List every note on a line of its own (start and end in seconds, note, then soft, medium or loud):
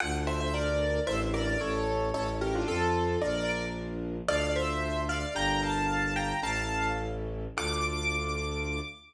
0.00 1.00 D2 loud
0.00 0.97 D4 medium
0.00 0.97 F4 medium
0.00 0.97 A4 medium
0.00 0.13 F#5 loud
0.27 0.40 C5 medium
0.27 0.40 E5 medium
0.40 0.53 C5 medium
0.40 0.53 E5 medium
0.54 0.99 A#4 medium
0.54 0.99 D5 medium
1.07 1.57 A1 loud
1.07 1.55 D4 medium
1.07 1.55 E4 medium
1.07 1.55 A4 medium
1.07 1.20 C5 medium
1.07 1.20 E5 medium
1.34 1.47 A#4 medium
1.34 1.47 D5 medium
1.47 1.60 A#4 medium
1.47 1.60 D5 medium
1.61 2.12 A1 loud
1.61 2.09 C#4 medium
1.61 2.09 E4 medium
1.61 2.09 A4 medium
1.61 2.09 C#5 medium
2.14 2.64 A1 loud
2.14 2.62 C#4 medium
2.14 2.62 E4 medium
2.14 2.62 A4 medium
2.14 2.27 A4 medium
2.14 2.27 C#5 medium
2.41 2.54 G4 medium
2.41 2.54 A#4 medium
2.55 2.68 D4 medium
2.55 2.67 F4 medium
2.68 3.17 F2 loud
2.68 3.17 C4 medium
2.68 3.19 F4 medium
2.68 3.17 F4 medium
2.68 3.19 A4 medium
2.68 3.17 A4 medium
3.21 4.21 A#1 loud
3.21 4.17 D4 medium
3.21 4.17 F4 medium
3.21 4.17 A#4 medium
3.21 3.65 A#4 medium
3.21 3.65 D5 medium
4.27 5.25 D2 loud
4.27 5.25 D4 medium
4.27 5.25 F4 medium
4.27 5.25 A4 medium
4.27 4.52 D5 medium
4.27 4.52 F5 medium
4.56 5.01 C5 medium
4.56 5.01 E5 medium
5.09 5.33 D5 medium
5.09 5.33 F5 medium
5.35 6.33 G1 loud
5.35 6.31 D4 medium
5.35 6.31 G4 medium
5.35 6.31 A#4 medium
5.35 5.61 G5 medium
5.35 5.61 A#5 loud
5.63 6.14 F5 medium
5.63 6.14 A5 medium
6.16 6.41 G5 medium
6.16 6.41 A#5 medium
6.43 7.47 A1 loud
6.43 7.45 C#4 medium
6.43 7.45 E4 medium
6.43 7.45 A4 medium
6.43 6.87 F5 medium
6.43 6.87 A5 loud
7.57 8.80 D2 loud
7.57 8.80 D4 medium
7.57 8.80 F4 loud
7.57 8.80 A4 medium
7.57 8.81 D6 loud